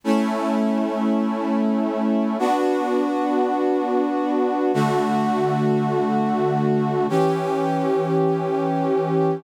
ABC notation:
X:1
M:4/4
L:1/8
Q:1/4=51
K:D
V:1 name="Brass Section"
[A,CE]4 [B,DF]4 | [D,A,F]4 [E,CG]4 |]